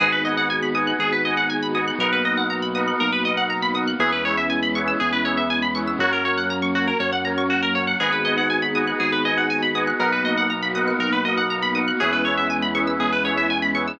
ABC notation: X:1
M:4/4
L:1/16
Q:1/4=120
K:G#m
V:1 name="Electric Piano 1"
[Bdfg]2 [Bdfg]4 [Bdfg]4 [Bdfg]4 [Bdfg]2 | [ABdf]2 [ABdf]4 [ABdf]4 [ABdf]4 [ABdf]2 | [GBce]2 [GBce]4 [GBce]4 [GBce]4 [GBce]2 | [FAc]2 [FAc]4 [FAc]4 [FAc]4 [FAc]2 |
[Bdfg]2 [Bdfg]4 [Bdfg]4 [Bdfg]4 [Bdfg]2 | [ABdf]2 [ABdf]4 [ABdf]4 [ABdf]4 [ABdf]2 | [GBce]2 [GBce]4 [GBce]4 [GBce]4 [GBce]2 |]
V:2 name="Pizzicato Strings"
G B d f g b d' f' G B d f g b d' f' | A B d f a b d' f' A B d f a b d' f' | G B c e g b c' e' G B c e g b c' e' | F A c f a c' F A c f a c' F A c f |
G B d f g b d' f' G B d f g b d' f' | A B d f a b d' f' A B d f a b d' f' | G B c e g b c' e' G B c e g b c' e' |]
V:3 name="Synth Bass 2" clef=bass
G,,,8 G,,,8 | B,,,8 B,,,8 | E,,8 E,,8 | F,,8 F,,8 |
G,,,8 G,,,8 | B,,,8 B,,,8 | E,,8 E,,8 |]
V:4 name="Pad 2 (warm)"
[B,DFG]16 | [A,B,DF]16 | [G,B,CE]16 | [F,A,C]16 |
[B,DFG]16 | [A,B,DF]16 | [G,B,CE]16 |]